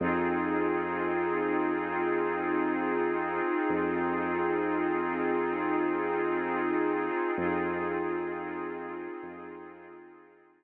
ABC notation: X:1
M:4/4
L:1/8
Q:1/4=65
K:Fphr
V:1 name="Pad 5 (bowed)"
[CEFA]8- | [CEFA]8 | [CEFA]8 |]
V:2 name="Synth Bass 2" clef=bass
F,,8 | F,,8 | F,,4 F,,4 |]